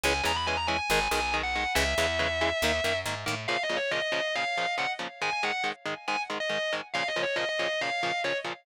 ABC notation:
X:1
M:4/4
L:1/16
Q:1/4=139
K:G#m
V:1 name="Distortion Guitar"
g2 a b g a g g g2 g2 z f3 | e12 z4 | [K:Bbm] (3f2 e2 d2 e e3 f4 g z3 | a a g2 z4 a z2 e3 z2 |
(3f2 e2 d2 e e3 f4 d z3 |]
V:2 name="Overdriven Guitar"
[E,G,C]2 [E,G,C]2 [E,G,C]2 [E,G,C]2 [D,G,]2 [D,G,]2 [D,G,]2 [D,G,]2 | [C,E,G,]2 [C,E,G,]2 [C,E,G,]2 [C,E,G,]2 [D,A,]2 [D,A,]2 [D,A,]2 [D,A,]2 | [K:Bbm] [B,,D,F,]2 [B,,D,F,]2 [B,,D,F,]2 [B,,D,F,]2 [B,,D,F,]2 [B,,D,F,]2 [B,,D,F,]2 [B,,D,F,]2 | [A,,E,A,]2 [A,,E,A,]2 [A,,E,A,]2 [A,,E,A,]2 [A,,E,A,]2 [A,,E,A,]2 [A,,E,A,]2 [A,,E,A,]2 |
[B,,D,F,]2 [B,,D,F,]2 [B,,D,F,]2 [B,,D,F,]2 [B,,D,F,]2 [B,,D,F,]2 [B,,D,F,]2 [B,,D,F,]2 |]
V:3 name="Electric Bass (finger)" clef=bass
C,,2 E,,6 G,,,2 B,,,6 | C,,2 E,,6 D,,2 F,,2 G,,2 =A,,2 | [K:Bbm] z16 | z16 |
z16 |]